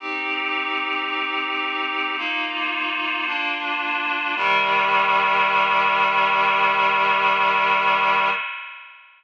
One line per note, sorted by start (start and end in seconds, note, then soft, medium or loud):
0.00 2.16 C4 medium
0.00 2.16 D#4 medium
0.00 2.16 G4 medium
2.18 3.26 A#3 medium
2.18 3.26 D#4 medium
2.18 3.26 F4 medium
3.27 4.35 A#3 medium
3.27 4.35 D4 medium
3.27 4.35 F4 medium
4.36 8.30 C3 medium
4.36 8.30 D#3 loud
4.36 8.30 G3 loud